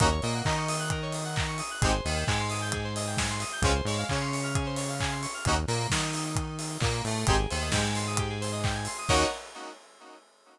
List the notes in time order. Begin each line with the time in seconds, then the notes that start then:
0.00 D#2 A#3 C#4 D#4 F#4 A#4, kick, closed hi-hat
0.11 C#5
0.22 A#2 A#3 D#5, open hi-hat
0.34 F#5
0.45 D#3 D#4 A#5, kick, clap
0.57 C#6
0.68 D#6, open hi-hat
0.79 F#6
0.90 A#4, kick, closed hi-hat
1.02 C#5
1.12 D#5, open hi-hat
1.25 F#5
1.36 A#5, kick, clap
1.48 C#6
1.58 D#6, open hi-hat
1.71 F#6
1.82 G#1 G#3 C4 D#4 G4 G#4, kick, closed hi-hat
1.93 C5
2.05 D#2 D#3 D#5, open hi-hat
2.16 G5
2.27 G#2 G#3 G#5, kick, clap
2.39 C6
2.50 D#6, open hi-hat
2.62 G6
2.72 G#4, kick, closed hi-hat
2.84 C5
2.96 D#5, open hi-hat
3.07 G5
3.17 G#5, kick, snare
3.30 C6
3.40 D#6, open hi-hat
3.52 G6
3.62 C#2 G#3 C4 C#4 F4 G#4, kick, closed hi-hat
3.75 C5
3.85 G#2 G#3 C#5, open hi-hat
3.98 F5
4.09 C#3 C#4 G#5, kick, clap
4.21 C6
4.32 C#6, open hi-hat
4.43 F6
4.55 G#4, kick, closed hi-hat
4.66 C5
4.76 C#5, open hi-hat
4.89 F5
5.00 G#5, kick, clap
5.11 C6
5.22 C#6, open hi-hat
5.34 F6
5.45 D#2 A#3 C#4 D#4 F#4, kick, closed hi-hat
5.68 A#2 A#3, open hi-hat
5.90 D#3 D#4, kick, snare
6.13 open hi-hat
6.36 kick, closed hi-hat
6.59 open hi-hat
6.80 A#2 A#3, kick, clap
7.05 A2 A3, open hi-hat
7.27 G#1 C4 D#4 G4 G#4, kick, closed hi-hat
7.39 G#4
7.50 D#2 D#3 C5, open hi-hat
7.61 D#5
7.72 G#2 G#3 G5, kick, snare
7.84 G#5
7.95 C6, open hi-hat
8.07 D#6
8.17 G4, kick, closed hi-hat
8.30 G#4
8.41 C5, open hi-hat
8.52 D#5
8.64 G5, kick, clap
8.75 G#5
8.85 C6, open hi-hat
8.98 D#6
9.09 D#2 A#3 C#4 D#4 F#4 A#4 C#5 D#5 F#5, kick, crash